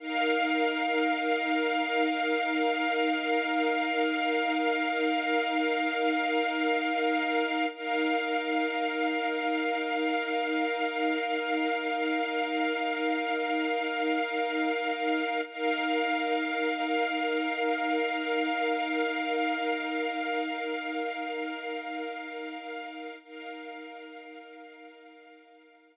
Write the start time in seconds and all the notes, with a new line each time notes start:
0.00 D#4 A#4 F5
7.75 D#4 A#4 F5
15.49 D#4 A#4 F5
23.24 D#4 A#4 F5